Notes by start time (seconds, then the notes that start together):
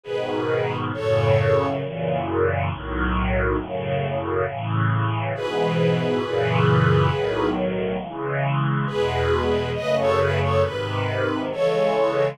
0.03 G#2 B2 D#3 G#4 B4
0.93 F#2 A2 C#3 A4 C#5
1.82 F#2 A#2 C#3 E3
2.69 B1 A2 D#3 F#3
3.57 F#2 A2 C#3
4.46 A2 C#3 E3
5.33 G#2 B2 E3 G#4 B4
6.22 F#2 A#2 C#3 E3
7.10 B1 A2 D#3 F#3
7.99 C#3 E3 G#3
8.87 E2 B2 G#3 G#4 B4
9.75 F#2 C#3 A3 B4 D#5
9.98 A4 C#5
10.19 G#4 B4
10.41 A4 C#5
10.63 G#2 C3 D#3 B4
11.52 C#3 E3 G#3 A4 C#5